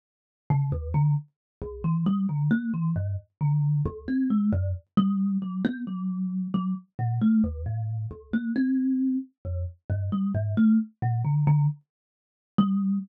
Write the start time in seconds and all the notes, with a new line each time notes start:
0.50 C#3
0.72 D#2
0.94 D3
1.62 C2
1.84 E3
2.06 G3
2.29 D3
2.51 A#3
2.74 E3
2.96 G2
3.41 D3
3.85 C#2
4.08 C4
4.30 G#3
4.53 F#2
4.97 G3
5.42 F#3
5.65 B3
5.87 F#3
6.54 F#3
6.99 A#2
7.21 A3
7.44 D#2
7.66 A2
8.11 C#2
8.33 A#3
8.56 C4
9.45 F2
9.90 G2
10.12 G3
10.35 G#2
10.57 A3
11.02 A#2
11.25 D3
11.47 D3
12.58 G3